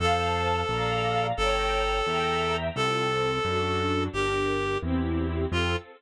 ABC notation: X:1
M:6/8
L:1/8
Q:3/8=87
K:F
V:1 name="Clarinet"
A6 | A6 | A6 | G3 z3 |
F3 z3 |]
V:2 name="String Ensemble 1"
[cfa]3 [dfb]3 | [_dgb]3 [egb]3 | [CFA]3 [D^FA]3 | [DGB]3 [CEG]3 |
[CFA]3 z3 |]
V:3 name="Acoustic Grand Piano" clef=bass
F,,3 B,,,3 | G,,,3 E,,3 | C,,3 ^F,,3 | G,,,3 E,,3 |
F,,3 z3 |]